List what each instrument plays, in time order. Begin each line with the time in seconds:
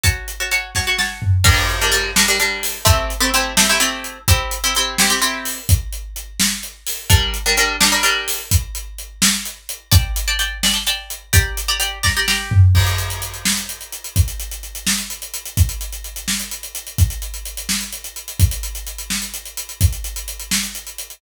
0.03 pizzicato strings F#4 C#5 A5, kick, closed hi-hat
0.28 closed hi-hat
0.40 pizzicato strings F#4 C#5 A5
0.51 pizzicato strings F#4 C#5 A5, closed hi-hat
0.75 pizzicato strings F#4 C#5 A5, kick, snare
0.87 pizzicato strings F#4 C#5 A5
0.98 pizzicato strings F#4 C#5 A5, snare
1.22 floor tom
1.44 pizzicato strings G3 D4 A#4, kick, crash
1.69 closed hi-hat
1.81 pizzicato strings G3 D4 A#4
1.92 pizzicato strings G3 D4 A#4, closed hi-hat
2.16 pizzicato strings G3 D4 A#4, snare
2.28 pizzicato strings G3 D4 A#4
2.40 pizzicato strings G3 D4 A#4, closed hi-hat
2.63 open hi-hat
2.85 pizzicato strings A3 C4 E4 G4, kick, closed hi-hat
3.10 closed hi-hat
3.20 pizzicato strings A3 C4 E4 G4
3.34 pizzicato strings A3 C4 E4 G4, closed hi-hat
3.57 pizzicato strings A3 C4 E4 G4, snare
3.69 pizzicato strings A3 C4 E4 G4
3.80 pizzicato strings A3 C4 E4 G4, closed hi-hat
4.04 closed hi-hat
4.28 pizzicato strings C4 E4 G4, kick, closed hi-hat
4.51 closed hi-hat
4.64 pizzicato strings C4 E4 G4
4.75 pizzicato strings C4 E4 G4, closed hi-hat
4.98 pizzicato strings C4 E4 G4, snare
5.10 pizzicato strings C4 E4 G4
5.22 pizzicato strings C4 E4 G4, closed hi-hat
5.45 open hi-hat
5.69 kick, closed hi-hat
5.92 closed hi-hat
6.16 closed hi-hat
6.40 snare
6.63 closed hi-hat
6.87 open hi-hat
7.10 pizzicato strings G3 D4 A#4, kick, closed hi-hat
7.34 closed hi-hat
7.46 pizzicato strings G3 D4 A#4
7.57 pizzicato strings G3 D4 A#4, closed hi-hat
7.80 pizzicato strings G3 D4 A#4, snare
7.92 pizzicato strings G3 D4 A#4
8.03 pizzicato strings G3 D4 A#4, closed hi-hat
8.28 open hi-hat
8.51 kick, closed hi-hat
8.75 closed hi-hat
8.98 closed hi-hat
9.22 snare
9.45 closed hi-hat
9.69 closed hi-hat
9.91 pizzicato strings D5 G5 A5, kick, closed hi-hat
10.16 closed hi-hat
10.28 pizzicato strings D5 G5 A5
10.39 pizzicato strings D5 G5 A5, closed hi-hat
10.63 pizzicato strings D5 G5 A5, snare
10.74 pizzicato strings D5 G5 A5
10.87 pizzicato strings D5 G5 A5, closed hi-hat
11.10 closed hi-hat
11.33 pizzicato strings G4 D5 A#5, kick, closed hi-hat
11.57 closed hi-hat
11.68 pizzicato strings G4 D5 A#5
11.80 pizzicato strings G4 D5 A#5, closed hi-hat
12.03 pizzicato strings G4 D5 A#5, kick, snare
12.17 pizzicato strings G4 D5 A#5
12.28 pizzicato strings G4 D5 A#5, snare
12.51 floor tom
12.75 kick, crash
12.87 closed hi-hat
12.98 closed hi-hat
13.10 closed hi-hat
13.22 closed hi-hat
13.34 closed hi-hat
13.45 snare
13.57 closed hi-hat
13.69 closed hi-hat
13.81 closed hi-hat
13.92 closed hi-hat
14.04 closed hi-hat
14.16 kick, closed hi-hat
14.28 closed hi-hat
14.40 closed hi-hat
14.51 closed hi-hat
14.63 closed hi-hat
14.75 closed hi-hat
14.87 snare
14.98 closed hi-hat
15.10 closed hi-hat
15.22 closed hi-hat
15.34 closed hi-hat
15.45 closed hi-hat
15.57 kick, closed hi-hat
15.69 closed hi-hat
15.81 closed hi-hat
15.92 closed hi-hat
16.04 closed hi-hat
16.16 closed hi-hat
16.28 snare
16.40 closed hi-hat
16.51 closed hi-hat
16.63 closed hi-hat
16.75 closed hi-hat
16.87 closed hi-hat
16.98 kick, closed hi-hat
17.10 closed hi-hat
17.22 closed hi-hat
17.34 closed hi-hat
17.45 closed hi-hat
17.57 closed hi-hat
17.69 snare
17.81 closed hi-hat
17.92 closed hi-hat
18.04 closed hi-hat
18.16 closed hi-hat
18.28 closed hi-hat
18.40 kick, closed hi-hat
18.51 closed hi-hat
18.63 closed hi-hat
18.75 closed hi-hat
18.87 closed hi-hat
18.98 closed hi-hat
19.10 snare
19.22 closed hi-hat
19.34 closed hi-hat
19.45 closed hi-hat
19.57 closed hi-hat
19.69 closed hi-hat
19.81 kick, closed hi-hat
19.92 closed hi-hat
20.04 closed hi-hat
20.16 closed hi-hat
20.28 closed hi-hat
20.40 closed hi-hat
20.51 snare
20.63 closed hi-hat
20.75 closed hi-hat
20.87 closed hi-hat
20.98 closed hi-hat
21.10 closed hi-hat